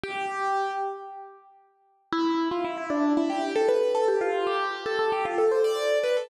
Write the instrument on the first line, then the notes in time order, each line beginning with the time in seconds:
acoustic grand piano
0.03 G4
2.12 E4
2.51 F4
2.64 E4
2.77 E4
2.90 D4
3.17 E4
3.30 G4
3.56 A4
3.68 B4
3.95 A4
4.08 G4
4.21 F4
4.47 G4
4.86 A4
4.99 A4
5.12 G4
5.25 F4
5.38 A4
5.51 C5
5.64 D5
6.03 B4
6.17 A4